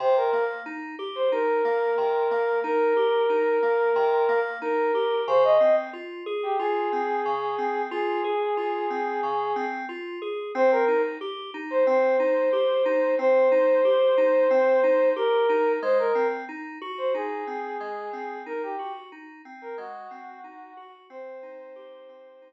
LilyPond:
<<
  \new Staff \with { instrumentName = "Ocarina" } { \time 4/4 \key c \phrygian \tempo 4 = 91 c''16 bes'8 r4 c''16 bes'2 | bes'2. bes'4 | c''16 ees''8 r4 g'16 aes'2 | aes'2. r4 |
c''16 bes'8 r4 c''16 c''2 | c''2. bes'4 | c''16 bes'8 r4 c''16 aes'2 | bes'16 g'8 r4 bes'16 ges'2 |
c''2~ c''8 r4. | }
  \new Staff \with { instrumentName = "Electric Piano 2" } { \time 4/4 \key c \phrygian c8 bes8 ees'8 g'8 ees'8 bes8 c8 bes8 | ees'8 g'8 ees'8 bes8 c8 bes8 ees'8 g'8 | des8 c'8 f'8 aes'8 f'8 c'8 des8 c'8 | f'8 aes'8 f'8 c'8 des8 c'8 f'8 aes'8 |
c'8 ees'8 g'8 ees'8 c'8 ees'8 g'8 ees'8 | c'8 ees'8 g'8 ees'8 c'8 ees'8 g'8 ees'8 | aes8 c'8 ees'8 ges'8 ees'8 c'8 aes8 c'8 | ees'8 ges'8 ees'8 c'8 aes8 c'8 ees'8 ges'8 |
c'8 ees'8 g'8 c'8 ees'8 r4. | }
>>